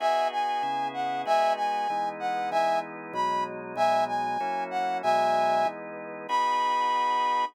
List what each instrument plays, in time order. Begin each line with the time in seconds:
0.00 drawbar organ B3 D#4 F#4 G#4, brass section E5 G#5
0.32 brass section G#5
0.63 drawbar organ C#3 B3 E4 G#4
0.94 brass section F#5
1.26 drawbar organ G#3 B3 D#4 F#4, brass section E5 G#5
1.56 brass section G#5
1.90 drawbar organ E3 G#3 B3 D#4
2.20 brass section F#5
2.51 drawbar organ E3 G#3 B3 D#4, brass section E5 G#5
3.13 drawbar organ B2 F#3 G#3 D#4, brass section B5
3.76 drawbar organ B2 F#3 G#3 D#4, brass section E5 G#5
4.08 brass section G#5
4.40 drawbar organ F#3 A#3 C#4 E4
4.71 brass section F#5
5.03 drawbar organ B2 F#3 G#3 D#4, brass section E5 G#5
5.65 drawbar organ E3 G#3 B3 D#4
6.28 drawbar organ B3 D#4 F#4 G#4, brass section B5